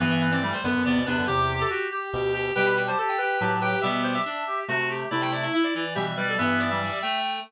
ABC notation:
X:1
M:6/8
L:1/16
Q:3/8=94
K:Em
V:1 name="Clarinet"
B e B d d c B2 d2 B2 | G4 z8 | g b g a a g g2 a2 g2 | G4 z8 |
d g d e e d d2 e2 d2 | B2 d4 g4 z2 |]
V:2 name="Clarinet"
B,3 C A,2 B,4 B,2 | G3 A F2 G4 G2 | B3 c A2 B4 B2 | e e c e5 z4 |
E6 E z G z B A | e3 e5 z4 |]
V:3 name="Clarinet"
E,4 G,2 B,2 B,2 D2 | G4 G2 G2 G2 G2 | G4 G2 G2 G2 G2 | B,4 D2 G2 F2 G2 |
E2 E2 E2 E,4 G,2 | B,3 G, G,2 A,4 z2 |]
V:4 name="Clarinet"
[G,,E,]6 [F,,D,] [F,,D,] [E,,C,] [D,,B,,] [E,,C,] [F,,D,] | [E,,C,]4 z4 [D,,B,,]4 | [B,,G,]4 z4 [A,,F,]4 | [B,,G,]4 z4 [C,A,]4 |
[C,A,]4 z4 [B,,G,]4 | [G,,E,]6 z6 |]